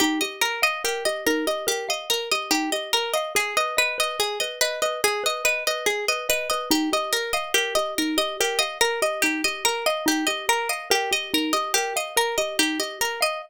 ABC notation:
X:1
M:4/4
L:1/8
Q:1/4=143
K:Ebmix
V:1 name="Pizzicato Strings"
G e B e G e B e | G e B e G e B e | A e _c e A e c e | A e _c e A e c e |
G e B e G e B e | G e B e G e B e | G e B e G e B e | G e B e G e B e |]
V:2 name="Xylophone"
E G B f B G E G | B f B G E G B f | A _c e c A c e c | A _c e c A c e c |
E G B f B G E G | B f B G E G B f | E G B f B G E G | B f B G E G B f |]